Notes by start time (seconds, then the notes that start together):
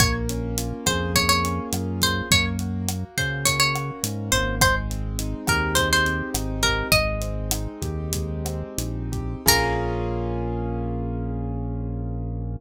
0.00 A#1 A#3 C#5, kick, cross-stick, closed hi-hat
0.29 C#4, closed hi-hat
0.58 F4, closed hi-hat
0.86 F2 G#4 C5, kick, cross-stick, closed hi-hat
1.15 A#3 C#5, kick, closed hi-hat
1.29 C#5
1.44 C#4, closed hi-hat
1.73 F#2 F4, cross-stick, closed hi-hat
2.01 G#4 C5, kick, closed hi-hat
2.31 F#2 A#3 C#5, kick, closed hi-hat
2.59 F#4, closed hi-hat
2.88 A#3, cross-stick, closed hi-hat
3.18 C#3 C#4 C5, kick, closed hi-hat
3.45 A#3 C#5, kick, closed hi-hat
3.60 C#5
3.75 F#4, cross-stick, closed hi-hat
4.03 G#2 C#4, closed hi-hat
4.32 G#1 A#3 C5, kick, closed hi-hat
4.61 G#3 C5, kick, cross-stick, closed hi-hat
4.90 C4, closed hi-hat
5.19 D#4, closed hi-hat
5.47 D#2 G4 A#4, kick, cross-stick, closed hi-hat
5.75 G#3 C5, kick, closed hi-hat
5.93 C5
6.06 C4, closed hi-hat
6.34 G#1 D#4, cross-stick, closed hi-hat
6.63 G4 A#4, kick, closed hi-hat
6.92 G#1 G#3 D#5, kick, closed hi-hat
7.21 C4, closed hi-hat
7.51 D#4, cross-stick, closed hi-hat
7.82 D#2 G4, kick, closed hi-hat
8.13 G#3, kick, closed hi-hat
8.45 C4, cross-stick, closed hi-hat
8.78 A#1 D#4, closed hi-hat
9.12 G4, kick, closed hi-hat
9.46 A#1 A#3 C#4 F4 G#4 A#4, kick, crash